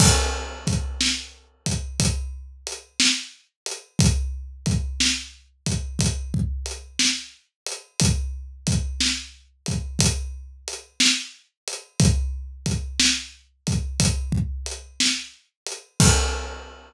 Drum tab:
CC |x-----------|------------|------------|------------|
HH |--x--xx-x--x|x-x--xx-x--x|x-x--xx-x--x|x-x--xx-x--x|
SD |---o-----o--|---o-----o--|---o-----o--|---o-----o--|
BD |o-o--oo-----|o-o--ooo----|o-o--oo-----|o-o--ooo----|

CC |x-----------|
HH |------------|
SD |------------|
BD |o-----------|